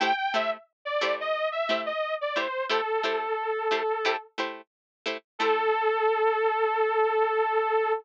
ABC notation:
X:1
M:4/4
L:1/16
Q:1/4=89
K:Ador
V:1 name="Lead 2 (sawtooth)"
g g e z2 d2 ^d2 e2 _e2 =d c2 | A10 z6 | A16 |]
V:2 name="Pizzicato Strings"
[A,EGc]2 [A,EGc]4 [A,EGc]4 [A,EGc]4 [A,EGc]2 | [A,EGc]2 [A,EGc]4 [A,EGc]2 [A,EGc]2 [A,EGc]4 [A,EGc]2 | [A,EGc]16 |]